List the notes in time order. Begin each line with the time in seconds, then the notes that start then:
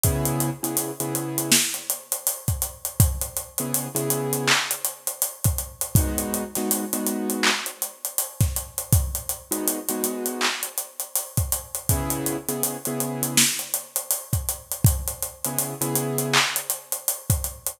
0.04 C#3 B3 E4 G#4, kick, closed hi-hat
0.25 closed hi-hat
0.40 closed hi-hat
0.63 C#3 B3 E4 G#4, closed hi-hat
0.77 closed hi-hat
1.00 C#3 B3 E4 G#4, closed hi-hat
1.15 closed hi-hat
1.38 closed hi-hat
1.52 snare
1.74 closed hi-hat
1.90 closed hi-hat
2.12 closed hi-hat
2.27 closed hi-hat
2.48 kick, closed hi-hat
2.62 closed hi-hat
2.85 closed hi-hat
3.00 kick, closed hi-hat
3.21 closed hi-hat
3.37 closed hi-hat
3.58 C#3 B3 E4 G#4, closed hi-hat
3.74 closed hi-hat
3.95 C#3 B3 E4 G#4, closed hi-hat
4.10 closed hi-hat
4.33 closed hi-hat
4.48 clap
4.71 closed hi-hat
4.85 closed hi-hat
5.07 closed hi-hat
5.22 closed hi-hat
5.44 kick, closed hi-hat
5.58 closed hi-hat
5.81 closed hi-hat
5.95 G#3 B3 D#4 F#4, kick, closed hi-hat
6.18 closed hi-hat
6.34 closed hi-hat
6.55 G#3 B3 D#4 F#4, snare, closed hi-hat
6.71 closed hi-hat
6.93 G#3 B3 D#4 F#4, closed hi-hat
7.06 closed hi-hat
7.30 closed hi-hat
7.43 clap
7.66 closed hi-hat
7.82 closed hi-hat
8.05 closed hi-hat
8.18 closed hi-hat
8.41 kick, snare, closed hi-hat
8.56 closed hi-hat
8.78 closed hi-hat
8.93 kick, closed hi-hat
9.15 closed hi-hat
9.29 closed hi-hat
9.51 G#3 B3 D#4 F#4, closed hi-hat
9.68 closed hi-hat
9.89 G#3 B3 D#4 F#4, closed hi-hat
10.04 closed hi-hat
10.26 closed hi-hat
10.41 clap
10.63 closed hi-hat
10.78 closed hi-hat
11.00 closed hi-hat
11.16 closed hi-hat
11.37 kick, closed hi-hat
11.52 closed hi-hat
11.75 closed hi-hat
11.89 C#3 B3 E4 G#4, kick, closed hi-hat
12.10 closed hi-hat
12.26 closed hi-hat
12.48 C#3 B3 E4 G#4, closed hi-hat
12.63 closed hi-hat
12.85 C#3 B3 E4 G#4, closed hi-hat
13.00 closed hi-hat
13.23 closed hi-hat
13.37 snare
13.59 closed hi-hat
13.74 closed hi-hat
13.96 closed hi-hat
14.11 closed hi-hat
14.33 kick, closed hi-hat
14.49 closed hi-hat
14.72 closed hi-hat
14.85 kick, closed hi-hat
15.08 closed hi-hat
15.23 closed hi-hat
15.45 C#3 B3 E4 G#4, closed hi-hat
15.58 closed hi-hat
15.81 C#3 B3 E4 G#4, closed hi-hat
15.96 closed hi-hat
16.18 closed hi-hat
16.33 clap
16.56 closed hi-hat
16.70 closed hi-hat
16.92 closed hi-hat
17.08 closed hi-hat
17.30 kick, closed hi-hat
17.44 closed hi-hat
17.67 closed hi-hat